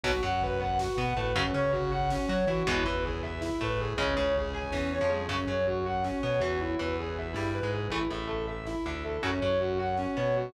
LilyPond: <<
  \new Staff \with { instrumentName = "Distortion Guitar" } { \time 7/8 \key fis \dorian \tempo 4 = 160 fis'8 fis''8 b'8 fis''8 fis'8 fis''8 b'8 | cis'8 cis''8 fis'8 fis''8 cis'8 cis''8 fis'8 | e'8 b'8 gis'8 e''8 e'8 b'8 gis'8 | cis'8 cis''8 gis'8 gis''8 cis'8 cis''8 gis'8 |
cis'8 cis''8 fis'8 fis''8 cis'8 cis''8 fis'8 | e'8 b'8 gis'8 e''8 e'8 b'8 gis'8 | e'8 e''8 a'8 e''8 e'8 e''8 a'8 | cis'8 cis''8 fis'8 fis''8 cis'8 cis''8 fis'8 | }
  \new Staff \with { instrumentName = "Overdriven Guitar" } { \time 7/8 \key fis \dorian <b, fis>16 r16 fis2 b8 a8 | <cis fis>16 r16 cis'2 fis'8 e'8 | <b, e gis>8 e2 a4 | <cis gis>8 cis4. e8. eis8. |
<cis fis>16 r16 fis2 b8 e8~ | e8 e4. g8. gis8. | <e a>16 r16 a,2 d4 | <cis fis>16 r16 fis2 b4 | }
  \new Staff \with { instrumentName = "Synth Bass 1" } { \clef bass \time 7/8 \key fis \dorian b,,8 fis,2 b,8 a,8 | fis,8 cis2 fis8 e8 | e,8 e,2 a,4 | cis,8 cis,4. e,8. eis,8. |
fis,8 fis,2 b,8 e,8~ | e,8 e,4. g,8. gis,8. | a,,8 a,,2 d,4 | fis,8 fis,2 b,4 | }
  \new DrumStaff \with { instrumentName = "Drums" } \drummode { \time 7/8 <cymc bd>16 bd16 <bd tomfh>16 bd16 <bd tomfh>16 bd16 <bd tomfh>16 bd16 <bd sn>16 bd16 <bd tomfh>16 bd16 <bd tomfh>16 bd16 | <bd tomfh>16 bd16 <bd tomfh>16 bd16 <bd tomfh>16 bd16 <bd tomfh>16 bd16 <bd sn>16 bd16 <bd tomfh>16 bd16 <bd tomfh>16 bd16 | <bd tomfh>16 bd16 <bd tomfh>16 bd16 <bd tomfh>16 bd16 <bd tomfh>16 bd16 <bd sn>16 bd16 <bd tomfh>16 bd16 <bd tomfh>16 bd16 | <bd tomfh>16 bd16 <bd tomfh>16 bd16 <bd tomfh>16 bd16 <bd tomfh>16 bd16 <bd sn>8 tommh8 toml8 |
<cymc bd>16 bd16 <bd tomfh>16 bd16 <bd tomfh>16 bd16 <bd tomfh>16 bd16 <bd sn>16 bd16 <bd tomfh>16 bd16 <bd tomfh>16 bd16 | <bd tomfh>16 bd16 <bd tomfh>16 bd16 <bd tomfh>16 bd16 <bd tomfh>16 bd16 <bd sn>16 bd16 <bd tomfh>16 bd16 <bd tomfh>16 bd16 | <bd tomfh>16 bd16 <bd tomfh>16 bd16 <bd tomfh>16 bd16 <bd tomfh>16 bd16 <bd sn>16 bd16 <bd tomfh>16 bd16 <bd tomfh>16 bd16 | <bd tomfh>16 bd16 <bd tomfh>16 bd16 <bd tomfh>16 bd16 <bd tomfh>16 bd16 <bd sn>8 tommh8 toml8 | }
>>